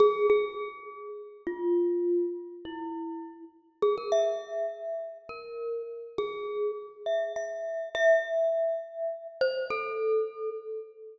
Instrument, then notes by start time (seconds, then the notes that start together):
glockenspiel
0.00 G#4
0.30 G#4
1.47 F4
2.65 E4
3.82 G#4
3.98 A#4
4.12 E5
5.29 A#4
6.18 G#4
7.06 E5
7.36 E5
7.95 E5
9.41 C5
9.70 A4